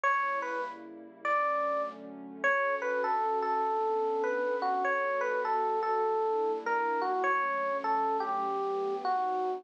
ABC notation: X:1
M:4/4
L:1/8
Q:"Swing" 1/4=100
K:D
V:1 name="Electric Piano 1"
c B z2 d2 z2 | c B A A3 B F | c B A A3 _B F | c2 A G3 F2 |]
V:2 name="Pad 2 (warm)"
[C,G,_B,E]4 [D,F,A,C]4 | [D,CFA]4 [B,CDA]4 | [G,B,FA]4 [G,_B,DE]4 | [D,F,A,C]4 [G,,F,A,B,]2 [^G,,F,^B,^D]2 |]